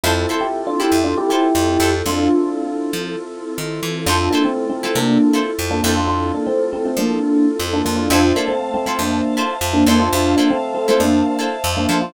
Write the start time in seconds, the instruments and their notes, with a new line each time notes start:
0.03 electric bass (finger) F2, electric piano 1 C4 E4, electric piano 2 C4 E4 F4 A4, acoustic guitar (steel) E4 F4 A4 C5
0.29 acoustic guitar (steel) E4 F4 A4 C5
0.41 electric piano 1 E4 G4
0.67 electric piano 1 D4 F4
0.80 acoustic guitar (steel) E4 F4 A4 C5, electric piano 1 E4 G4
0.92 electric bass (finger) F2
1.04 electric piano 1 D4 F4
1.17 electric piano 1 E4 G4
1.29 electric piano 1 E4 G4, acoustic guitar (steel) E4 F4 A4 C5
1.55 electric bass (finger) F2
1.80 electric bass (finger) F2, acoustic guitar (steel) E4 F4 A4 C5
2.06 electric bass (finger) F2, electric piano 2 C4 E4 F4 A4, electric piano 1 D4 F4
2.93 electric bass (finger) F3
3.58 electric bass (finger) D#3
3.83 electric bass (finger) E3
4.06 electric bass (finger) F2, electric piano 2 C4 E4 F4 A4, electric piano 1 D4 F4, acoustic guitar (steel) E4 F4 A4 C5
4.31 electric piano 1 A#3 D4, acoustic guitar (steel) E4 F4 A4
4.35 acoustic guitar (steel) C5
4.44 electric piano 1 A3 C4
4.70 electric piano 1 A3 C4
4.83 electric piano 1 A3 C4, acoustic guitar (steel) E4 F4 A4 C5
4.95 electric bass (finger) C3, electric piano 1 A#3 D4
5.33 acoustic guitar (steel) E4 F4 A4 C5
5.59 electric bass (finger) F2
5.71 electric piano 1 A#3 D4
5.83 electric bass (finger) F2, electric piano 1 A#3 D4, electric piano 2 C4 E4 F4 A4, acoustic guitar (steel) E4 F4 A4 C5
5.97 electric piano 1 D4 F4
6.07 electric piano 1 D4 F4
6.34 electric piano 1 A#3 D4
6.46 electric piano 1 A3 C4
6.73 electric piano 1 A3 C4
6.85 electric piano 1 A3 C4
6.97 electric bass (finger) F3, electric piano 1 A#3 D4
7.59 electric bass (finger) F2
7.73 electric piano 1 A#3 D4
7.85 electric bass (finger) F2, electric piano 1 A#3 D4
7.96 electric piano 1 D4 F4
8.10 electric bass (finger) F2, electric piano 1 D4 F4, acoustic guitar (steel) E4 F4 A4 C5, electric piano 2 C5 E5 F5 A5
8.36 electric piano 1 A#3 D4, acoustic guitar (steel) E4 F4 A4 C5
8.48 electric piano 1 A3 C4
8.74 electric piano 1 A3 C4
8.86 electric piano 1 A3 C4, acoustic guitar (steel) E4 F4 A4 C5
8.99 electric bass (finger) F2, electric piano 1 A#3 D4
9.37 acoustic guitar (steel) E4 F4 A4 C5
9.61 electric bass (finger) F2
9.73 electric piano 1 A#3 D4
9.86 electric bass (finger) F2, electric piano 1 A#3 D4, acoustic guitar (steel) E4 F4 A4 C5
9.99 electric piano 1 D4 F4
10.12 electric bass (finger) F2, electric piano 1 D4 F4, electric piano 2 C5 E5 F5 A5
10.36 electric piano 1 A#3 D4, acoustic guitar (steel) E4 F4 A4 C5
10.50 electric piano 1 A3 C4
10.75 electric piano 1 A3 C4
10.88 electric piano 1 A3 C4, acoustic guitar (steel) E4 F4 A4 C5
11.00 electric bass (finger) F2, electric piano 1 A#3 D4
11.39 acoustic guitar (steel) E4 F4 A4 C5
11.64 electric bass (finger) F2
11.77 electric piano 1 A#3 D4
11.89 electric bass (finger) F3, electric piano 1 A#3 D4, acoustic guitar (steel) E4 F4 A4 C5
12.02 electric piano 1 D4 F4